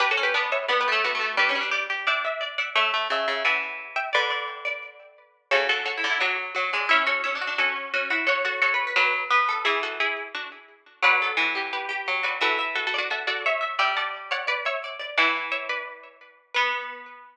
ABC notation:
X:1
M:4/4
L:1/8
Q:1/4=174
K:Bm
V:1 name="Harpsichord"
(3[GB] [FA] [GB] [Bd] [ce] (3[Bd] [GB] [Ac] [DF]2 | [Bd]4 [eg]3 [df] | [ce]4 [fa]3 [eg] | [Bd]5 z3 |
[K:F#m] [Ac] [FA] [Ac]2 [DF] z3 | [ce] [Ac] [ce]2 [FA] z3 | [Ac] [FA] [Ac]2 [DF] z3 | [EG] [FA] [EG]2 [DF] z3 |
[K:Bm] [df]4 [GB]3 [Bd] | [FA] z (3[FA] [FA] [DF] [FA] [FA] [ce]2 | [eg] [fa]2 [df] [Bd] [ce]3 | [fa]2 [ce] [Bd]3 z2 |
B8 |]
V:2 name="Harpsichord"
(3B c B B,2 B, A, B, A, | (3D C D d2 d e d e | e2 e2 e4 | d d2 d5 |
[K:F#m] F2 (3F E E F2 F D | C2 (3C D D C2 C E | c2 (3c B B B2 B A | e5 z3 |
[K:Bm] B A F G2 G2 F | e e2 d e d e e | d d2 c d c d d | E6 z2 |
B,8 |]
V:3 name="Harpsichord"
D C D2 (3B,2 A,2 A,2 | G, G, G G D4 | A, A, C, C, E,4 | D,5 z3 |
[K:F#m] C, D,2 D, F,2 F, G, | E F2 F F2 F F | F F F2 F,2 B,2 | E,6 z2 |
[K:Bm] F,2 E,4 F,2 | E,8 | G,8 | E,4 z4 |
B,8 |]